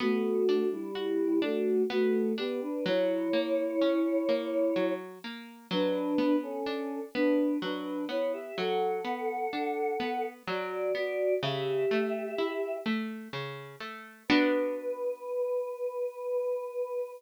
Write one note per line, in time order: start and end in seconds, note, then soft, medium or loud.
0.00 0.67 A3 medium
0.00 0.43 B3 medium
0.00 0.67 F#4 medium
0.49 0.92 D4 medium
0.72 1.39 G3 medium
0.72 1.39 E4 medium
0.95 1.38 F#4 medium
1.42 1.82 A3 medium
1.42 1.85 D4 medium
1.42 1.82 F#4 medium
1.90 2.33 A3 medium
1.90 2.33 B3 medium
1.90 2.33 F#4 medium
2.38 2.61 B3 medium
2.38 2.81 D4 medium
2.38 2.61 G4 medium
2.62 2.84 D4 medium
2.62 2.84 B4 medium
2.86 3.29 F#3 medium
2.86 4.93 E4 medium
2.86 4.93 C#5 loud
3.33 3.76 A#3 medium
3.82 4.24 C#4 medium
4.29 4.72 A#3 medium
4.76 5.19 F#3 medium
5.24 5.67 A#3 medium
5.71 6.14 F#3 medium
5.71 6.36 D4 medium
5.71 6.36 B4 loud
6.18 6.61 B3 medium
6.43 7.00 C#4 medium
6.43 7.00 A4 medium
6.66 7.09 D4 medium
7.14 7.58 B3 medium
7.14 7.58 D4 medium
7.14 7.58 B4 medium
7.62 8.05 F#3 medium
7.62 8.05 D4 medium
7.62 8.05 B4 medium
8.09 8.52 B3 medium
8.09 8.32 E4 medium
8.09 8.32 C#5 medium
8.33 8.56 G4 medium
8.33 8.56 E5 medium
8.58 9.01 F#3 medium
8.58 10.26 A4 medium
8.58 10.26 F#5 medium
9.05 9.47 B3 medium
9.53 9.96 D4 medium
10.00 10.43 B3 medium
10.47 10.90 F#3 medium
10.47 10.92 F#4 medium
10.47 10.92 D5 medium
10.95 11.38 B3 medium
10.95 11.34 F#4 medium
10.95 11.34 D5 medium
11.43 11.86 C#3 medium
11.43 12.76 G4 medium
11.43 12.76 E5 loud
11.91 12.34 A3 medium
12.38 12.81 E4 medium
12.86 13.29 A3 medium
13.33 13.76 C#3 medium
13.80 14.23 A3 medium
14.28 17.12 B3 loud
14.28 17.12 D4 loud
14.28 17.12 F#4 loud
14.28 17.10 B4 loud